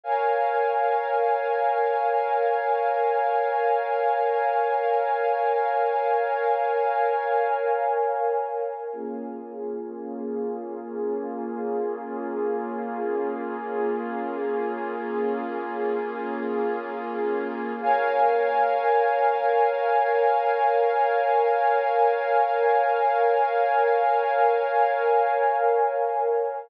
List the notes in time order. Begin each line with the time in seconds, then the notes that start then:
0.03 A#4 C#5 F5 G#5
8.92 A#3 C#4 F4 G#4
17.81 A#4 C#5 F5 G#5